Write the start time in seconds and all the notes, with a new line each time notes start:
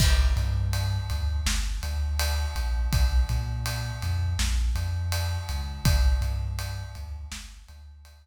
0.00 G1, kick, crash
0.36 G2, ride
0.73 ride
1.10 D2, ride
1.46 G1, snare
1.83 D2, ride
2.20 ride
2.55 A#1, ride
2.93 A#1, kick, ride
3.29 A#2, ride
3.66 ride
4.02 F2, ride
4.39 A#1, snare
4.75 F2, ride
5.12 ride
5.49 C#2, ride
5.84 G1, kick, ride
6.21 G2, ride
6.59 ride
6.95 D2, ride
7.32 G1, snare
7.68 D2, ride
8.05 ride